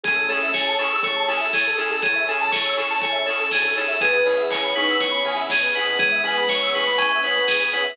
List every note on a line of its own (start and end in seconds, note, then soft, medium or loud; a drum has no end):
0.04 0.27 A1 medium
0.04 0.48 A3 loud
0.04 2.00 C#4 medium
0.04 0.13 C#4 medium
0.04 0.48 C#4 loud
0.04 2.00 E4 medium
0.04 0.13 E4 medium
0.04 0.15 G#4 medium
0.04 2.00 G#4 medium
0.04 0.27 G#4 medium
0.04 0.13 G#4 medium
0.04 2.00 A4 medium
0.04 0.13 A4 medium
0.04 kick loud
0.04 closed hi-hat loud
0.16 0.27 A4 medium
0.28 0.40 A1 medium
0.28 0.47 C#4 medium
0.28 0.47 E4 medium
0.28 0.47 G#4 medium
0.28 0.52 A4 medium
0.28 0.47 A4 medium
0.28 0.39 C#5 medium
0.28 open hi-hat medium
0.42 0.53 A1 medium
0.42 0.53 E5 medium
0.53 0.77 A1 medium
0.53 0.76 C#5 medium
0.53 0.65 G#5 medium
0.53 kick medium
0.53 snare medium
0.66 0.77 A5 medium
0.78 0.96 C#4 medium
0.78 0.96 E4 medium
0.78 1.00 G#4 loud
0.78 0.96 G#4 medium
0.78 1.01 A4 medium
0.78 0.96 A4 medium
0.78 0.90 C#6 medium
0.78 open hi-hat medium
0.92 1.03 E6 medium
1.03 1.28 A3 medium
1.03 1.26 C#5 medium
1.03 1.14 C#6 medium
1.03 kick medium
1.03 closed hi-hat medium
1.16 1.27 A5 medium
1.28 1.51 A1 medium
1.28 1.45 C#4 medium
1.28 1.45 E4 medium
1.28 1.45 G#4 medium
1.28 1.45 A4 medium
1.28 1.52 A4 medium
1.28 1.39 G#5 medium
1.28 open hi-hat medium
1.40 1.51 E5 medium
1.53 1.75 E2 medium
1.53 1.76 G#4 medium
1.53 1.64 C#5 medium
1.53 kick medium
1.53 snare medium
1.67 1.78 A4 medium
1.77 1.95 C#4 medium
1.77 1.95 E4 medium
1.77 1.95 G#4 medium
1.77 1.89 G#4 medium
1.77 1.95 A4 medium
1.77 2.01 A4 medium
1.77 open hi-hat medium
1.90 2.12 A1 medium
1.90 2.02 A4 medium
2.02 2.42 C#3 medium
2.02 2.42 E3 loud
2.02 3.98 C#4 medium
2.02 3.98 E4 medium
2.02 2.25 G#4 medium
2.02 3.98 A4 medium
2.02 3.98 C#5 medium
2.02 2.14 C#5 medium
2.02 kick medium
2.02 closed hi-hat loud
2.15 2.27 E5 medium
2.28 2.45 C#4 medium
2.28 2.45 E4 medium
2.28 2.45 G#4 medium
2.28 2.45 A4 medium
2.28 2.51 A4 medium
2.28 2.39 G#5 medium
2.28 open hi-hat medium
2.41 2.52 A5 medium
2.51 2.75 C#5 medium
2.51 2.63 C#6 medium
2.51 kick medium
2.51 snare loud
2.65 2.77 E6 medium
2.77 2.94 C#4 medium
2.77 2.94 E4 medium
2.77 2.94 G#4 medium
2.77 2.94 A4 medium
2.77 3.00 A4 medium
2.77 2.88 C#6 medium
2.77 open hi-hat medium
2.90 3.02 A5 medium
3.02 3.25 C#5 medium
3.02 3.14 G#5 medium
3.02 kick medium
3.02 closed hi-hat medium
3.12 3.23 E5 medium
3.25 3.44 C#4 medium
3.25 3.44 E4 medium
3.25 3.44 G#4 medium
3.25 3.49 A4 medium
3.25 3.44 A4 medium
3.25 3.37 C#5 medium
3.25 open hi-hat medium
3.39 3.50 A4 medium
3.51 3.74 D2 medium
3.51 3.63 G#4 medium
3.51 3.75 G#4 medium
3.51 kick medium
3.51 snare loud
3.63 3.74 A4 medium
3.76 3.99 D#2 medium
3.76 3.85 C#4 medium
3.76 3.85 E4 medium
3.76 3.85 G#4 medium
3.76 3.85 A4 medium
3.76 4.00 A4 medium
3.76 3.88 C#5 medium
3.76 open hi-hat medium
3.88 3.99 E5 medium
4.00 4.24 E2 loud
4.00 4.09 B3 medium
4.00 5.97 B3 medium
4.00 4.09 C#4 medium
4.00 5.97 C#4 medium
4.00 4.09 E4 medium
4.00 5.97 E4 medium
4.00 4.09 G#4 medium
4.00 4.43 G#4 loud
4.00 4.24 G#4 medium
4.00 5.97 G#4 loud
4.00 4.13 G#4 loud
4.00 4.43 B4 loud
4.00 kick medium
4.00 closed hi-hat loud
4.13 4.24 B4 medium
4.25 4.37 B2 medium
4.25 4.43 B3 medium
4.25 4.43 C#4 medium
4.25 4.43 E4 medium
4.25 4.43 G#4 medium
4.25 4.37 C#5 medium
4.25 4.49 B5 medium
4.25 open hi-hat medium
4.37 4.49 E2 medium
4.37 4.48 E5 medium
4.50 4.72 E2 medium
4.50 4.74 C#5 medium
4.50 4.63 G#5 medium
4.50 kick medium
4.50 clap loud
4.63 4.74 B5 medium
4.75 4.93 B3 medium
4.75 4.93 C#4 medium
4.75 4.95 D#4 loud
4.75 4.93 E4 medium
4.75 4.93 G#4 medium
4.75 4.98 B4 medium
4.75 4.88 C#6 medium
4.75 open hi-hat medium
4.89 5.00 E6 medium
5.00 5.22 B3 loud
5.00 5.23 C#5 medium
5.00 5.12 C#6 medium
5.00 kick medium
5.00 closed hi-hat loud
5.11 5.22 B5 medium
5.24 5.47 E2 medium
5.24 5.41 B3 medium
5.24 5.41 C#4 medium
5.24 5.41 E4 medium
5.24 5.41 G#4 medium
5.24 5.37 G#5 medium
5.24 5.47 B5 medium
5.24 open hi-hat medium
5.37 5.48 E5 medium
5.49 5.72 B2 medium
5.49 5.74 G#4 medium
5.49 5.61 C#5 medium
5.49 kick medium
5.49 snare loud
5.62 5.74 B4 medium
5.74 5.93 B3 medium
5.74 5.93 C#4 medium
5.74 5.93 E4 medium
5.74 5.86 G#4 medium
5.74 5.93 G#4 medium
5.74 5.98 B4 medium
5.74 open hi-hat medium
5.86 6.09 B2 medium
5.86 5.98 B4 medium
5.99 6.70 E3 loud
5.99 6.70 G#3 loud
5.99 7.95 B3 loud
5.99 7.95 C#4 medium
5.99 6.21 G#4 medium
5.99 7.95 G#4 medium
5.99 7.95 B4 loud
5.99 6.10 C#5 medium
5.99 kick loud
5.99 closed hi-hat medium
6.12 6.23 E5 medium
6.23 6.40 B3 medium
6.23 6.40 C#4 medium
6.23 6.40 E4 medium
6.23 6.40 G#4 medium
6.23 6.48 B4 medium
6.23 6.35 G#5 medium
6.23 open hi-hat medium
6.36 6.48 B5 medium
6.49 6.71 C#5 medium
6.49 6.61 C#6 medium
6.49 kick medium
6.49 snare medium
6.62 6.73 E6 medium
6.73 7.36 A3 loud
6.73 6.92 B3 medium
6.73 6.92 C#4 medium
6.73 6.92 E4 medium
6.73 6.92 G#4 medium
6.73 6.97 B4 medium
6.73 6.84 C#6 medium
6.73 open hi-hat medium
6.86 6.97 B5 medium
6.98 7.21 C#4 medium
6.98 7.09 G#5 medium
6.98 kick medium
6.98 closed hi-hat loud
7.11 7.22 E5 medium
7.23 7.41 B3 medium
7.23 7.41 C#4 medium
7.23 7.41 E4 medium
7.23 7.41 G#4 medium
7.23 7.46 B4 medium
7.23 7.34 C#5 medium
7.23 open hi-hat medium
7.35 7.46 B4 medium
7.47 7.70 G#4 medium
7.47 7.61 G#4 medium
7.47 kick medium
7.47 snare loud
7.60 7.71 B4 medium
7.73 7.81 B3 medium
7.73 7.81 C#4 medium
7.73 7.81 E4 medium
7.73 7.81 G#4 medium
7.73 7.96 B4 medium
7.73 7.84 C#5 medium
7.73 open hi-hat medium
7.84 7.96 E5 medium